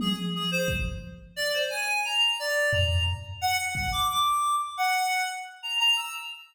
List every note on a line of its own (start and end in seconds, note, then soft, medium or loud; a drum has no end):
0.00 0.16 G#4 medium
0.00 high tom medium
0.35 0.50 G#4 medium
0.51 0.67 C5 loud
0.68 kick medium
1.36 1.52 D5 loud
1.54 1.69 C5 medium
1.70 2.01 G#5 medium
2.05 2.36 A#5 medium
2.39 2.70 D5 loud
2.72 3.03 A#5 medium
2.72 floor tom medium
3.07 floor tom medium
3.41 3.57 F#5 loud
3.58 3.74 F#5 medium
3.75 3.90 F#5 medium
3.75 kick medium
3.92 4.07 D6 loud
4.09 4.55 D6 loud
4.77 5.23 F#5 medium
5.63 5.78 A#5 medium
5.80 5.95 A#5 loud
5.97 6.12 E6 loud